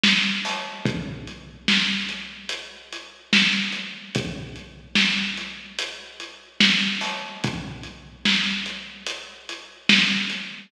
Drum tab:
HH |---o--|x--x-----x--x--x-----x--|x--x-----x--x--x-----o--|x--x-----x--x--x-----x--|
SD |o-----|------o-----------o-----|------o-----------o-----|------o-----------o-----|
BD |------|o-----------------------|o-----------------------|o-----------------------|